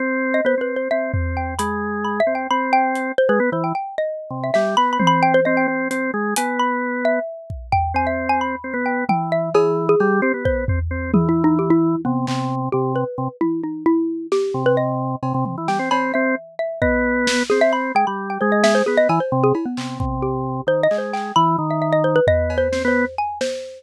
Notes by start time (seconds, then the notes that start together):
0.00 C4
0.34 D#5
0.45 B3 C5
0.58 C4 B4
0.76 C5
0.91 C4 E5
1.13 C4, floor tom
1.37 G5
1.59 G#3 B5, closed hi-hat
2.05 B5
2.20 E5
2.27 C4
2.35 G5
2.50 C4 B5
2.73 G5
2.95 closed hi-hat
3.18 C5
3.29 G#3 B4
3.40 B3
3.52 E3 C5
3.64 G5
3.75 G5
3.98 D#5
4.30 C3
4.44 E5
4.54 G3 E5, snare
4.77 B3 B5
4.93 B5
4.99 C4, high tom
5.07 B5
5.23 G5
5.34 C5
5.45 C4 D#5
5.57 G5
5.68 C4
5.91 C4, closed hi-hat
6.14 G#3
6.36 B3 G#5, closed hi-hat
6.59 B5
7.05 E5
7.50 kick
7.72 G5, floor tom
7.94 C4 G#5
8.07 E5
8.29 G#5
8.41 B5
8.64 C4
8.74 B3
8.86 G5
9.09 E3 G5, high tom
9.32 E5
9.54 E3 G#4, cowbell
9.89 G#4
10.00 G3, cowbell
10.22 C4 G4
10.34 B3
10.45 C5, kick
10.68 C4, floor tom
10.91 C4
11.14 E3 G#4, high tom
11.29 E4
11.44 D#4
11.59 G4
11.70 E4
12.05 C3 B3
12.27 C3, clap
12.72 C3 G4
12.96 B4
13.18 C3
13.41 E4, high tom
13.64 D#4
13.86 E4
14.32 G4, snare
14.54 C3
14.66 B4
14.77 D#5
15.23 C3, cowbell
15.34 C3
15.45 C3, high tom
15.58 E3
15.68 G3 G5, snare
15.79 C4
15.91 C4 B5, cowbell
16.14 C4 E5
16.59 E5
16.82 B3 D#5, kick
17.27 snare
17.50 C4 G#4, snare
17.61 E5
17.73 B5
17.95 G#3 G5
18.07 G3 B5
18.30 G5
18.41 G#3 C5
18.52 D#5
18.64 E5, snare
18.75 C5
18.86 B3 G#4
18.97 D#5
19.09 E3 G#5, cowbell
19.20 C5
19.32 C3
19.44 G#4
19.55 E4, cowbell
19.66 B3
19.77 C3, clap
20.00 C3, kick
20.22 G4
20.67 D#3 C5
20.83 D#5
20.91 G#3, clap
20.98 C5
21.13 G5, clap
21.36 E3 B5, cowbell
21.58 D#3
21.71 E5
21.82 E5
21.93 D#5
22.04 C5
22.16 B4
22.27 B3 D#5, floor tom
22.50 cowbell
22.58 C5
22.72 C4, snare
22.85 B3 C5
23.18 G#5
23.41 C5, snare